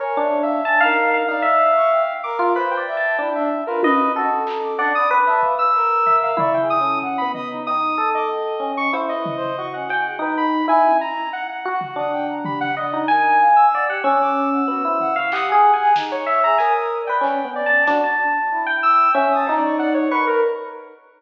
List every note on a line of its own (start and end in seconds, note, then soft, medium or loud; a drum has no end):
0.00 0.14 A#4 medium
0.00 0.38 C#5 medium
0.00 0.19 G#5 medium
0.17 0.60 D4 loud
0.21 0.40 E5 soft
0.43 0.81 E5 medium
0.43 0.62 F5 medium
0.64 0.78 G#5 medium
0.64 0.79 A5 medium
0.80 1.23 D#4 loud
0.80 1.09 F5 loud
0.85 1.23 A#4 medium
1.14 1.28 F5 medium
1.28 1.43 D#4 medium
1.28 1.71 D5 medium
1.28 2.14 F5 medium
1.42 2.00 E5 loud
1.76 1.90 C#6 medium
1.91 2.20 G5 medium
2.23 2.52 A#4 loud
2.23 2.38 D6 medium
2.39 2.53 F4 loud
2.55 2.75 B4 medium
2.55 2.84 C5 loud
2.55 2.69 B5 medium
2.71 3.29 G5 medium
2.77 2.96 D5 medium
2.88 3.16 E5 loud
2.97 3.16 A5 medium
3.19 3.62 D4 medium
3.19 3.34 E4 medium
3.35 3.49 D4 loud
3.35 3.64 E5 medium
3.67 3.82 F4 medium
3.67 3.81 A#4 medium
3.67 3.81 B4 medium
3.83 4.12 B4 loud
3.83 4.13 D#5 loud
3.83 high tom loud
4.15 4.44 F#4 loud
4.15 4.74 A4 medium
4.47 4.61 A#5 medium
4.47 clap medium
4.63 4.77 D6 medium
4.78 4.93 D4 loud
4.78 5.07 D5 medium
4.78 4.93 F#5 medium
4.95 5.09 B5 medium
4.95 5.09 D#6 loud
5.11 5.54 B4 loud
5.11 5.25 D6 medium
5.27 5.55 E5 medium
5.27 5.41 A5 loud
5.43 5.71 F5 medium
5.43 kick medium
5.59 6.16 E6 loud
5.75 6.32 A#4 loud
6.06 6.35 E5 medium
6.06 floor tom medium
6.23 6.37 F5 medium
6.37 6.75 E4 loud
6.37 6.53 D5 medium
6.37 6.57 C#6 medium
6.37 floor tom loud
6.54 6.68 G5 medium
6.60 6.79 G#4 medium
6.70 6.99 D#6 loud
6.81 7.19 C#4 medium
6.81 7.00 A4 medium
7.02 7.31 F#5 loud
7.02 kick medium
7.18 7.60 B3 medium
7.18 7.32 B5 medium
7.34 7.63 D#5 medium
7.34 7.49 D#6 loud
7.34 floor tom medium
7.50 7.64 D#4 medium
7.66 7.96 D#4 medium
7.66 7.80 G5 medium
7.66 8.10 D#6 loud
7.98 8.55 A4 medium
7.98 8.12 A4 medium
8.14 8.72 D#5 medium
8.14 8.28 D6 medium
8.30 8.87 G5 medium
8.60 8.89 C#4 medium
8.77 8.92 C#6 loud
8.93 9.50 E4 medium
8.93 9.13 C5 medium
8.93 cowbell loud
9.09 9.66 D#5 medium
9.15 9.34 B4 medium
9.26 floor tom loud
9.36 9.55 C5 loud
9.58 9.87 F#4 medium
9.58 9.72 C#6 medium
9.73 9.88 C#4 medium
9.73 10.16 F#5 medium
9.89 10.19 G5 medium
9.89 10.04 G#5 medium
9.89 cowbell medium
10.05 10.20 G#4 soft
10.19 10.62 D#4 loud
10.19 10.36 B4 medium
10.37 10.66 B5 medium
10.68 10.97 E4 loud
10.68 10.97 G#5 medium
10.85 high tom medium
11.01 11.30 A#5 medium
11.33 11.47 F#5 medium
11.49 12.35 F#5 medium
11.65 11.93 F#4 medium
11.65 11.80 F#4 loud
11.81 floor tom medium
11.96 12.68 D4 medium
11.96 12.11 D#6 medium
12.13 12.27 G5 loud
12.29 12.43 A#5 medium
12.45 12.74 G4 medium
12.45 12.59 B5 medium
12.45 floor tom loud
12.61 12.75 F#5 loud
12.76 13.05 D5 medium
12.76 12.91 D#5 medium
12.76 13.06 D#5 medium
12.93 13.08 D#4 medium
13.08 13.37 A#4 medium
13.08 13.51 G#5 medium
13.08 13.66 G#5 loud
13.40 13.69 F5 medium
13.56 13.85 E6 medium
13.72 13.89 D5 medium
13.72 13.87 F#5 medium
13.88 14.03 G4 medium
13.88 14.04 F#5 medium
14.04 14.61 C#4 loud
14.04 14.18 D6 medium
14.04 15.19 E6 medium
14.20 14.49 D6 medium
14.52 14.67 F#5 medium
14.68 14.82 B3 medium
14.68 14.82 F#4 medium
14.84 15.13 E4 medium
14.84 14.98 C5 medium
15.00 15.14 F#5 loud
15.00 floor tom medium
15.16 15.30 F5 loud
15.16 15.31 C#6 medium
15.32 15.52 G4 medium
15.32 15.90 F#5 medium
15.32 15.46 D#6 loud
15.32 clap loud
15.48 15.76 G#5 loud
15.52 15.71 G#4 loud
15.74 15.93 G#5 medium
15.80 15.94 G#4 loud
15.96 16.24 D#4 medium
15.96 snare loud
16.12 16.40 C#5 medium
16.26 16.55 E5 medium
16.26 16.42 C#6 medium
16.44 16.58 G#4 medium
16.44 16.58 A#5 medium
16.58 17.03 A#4 medium
16.58 16.73 G#5 medium
16.58 16.98 D#6 medium
16.58 closed hi-hat medium
17.02 17.41 D5 medium
17.07 17.24 B4 medium
17.07 17.50 G5 medium
17.21 17.40 C#4 medium
17.21 clap medium
17.45 17.64 B3 medium
17.45 17.83 C#4 medium
17.55 17.84 D5 medium
17.66 17.85 A5 medium
17.87 18.02 D4 loud
17.87 18.16 F#4 medium
17.87 snare medium
18.04 18.61 A5 medium
18.51 19.09 E4 medium
18.66 19.10 G5 medium
18.83 19.12 E6 loud
19.14 19.43 C#4 loud
19.14 19.34 E5 medium
19.14 19.29 G#5 medium
19.31 19.45 D#6 medium
19.36 19.55 A5 medium
19.47 19.61 D#4 loud
19.47 20.07 D#4 loud
19.47 cowbell medium
19.57 19.76 D5 medium
19.63 19.77 C#6 medium
19.79 19.93 D5 loud
19.79 19.93 F#5 medium
19.94 20.09 C#5 medium
19.94 20.09 D5 medium
20.11 20.39 A#4 medium
20.11 20.40 B4 medium
20.11 20.25 C#6 medium
20.27 20.41 A#4 loud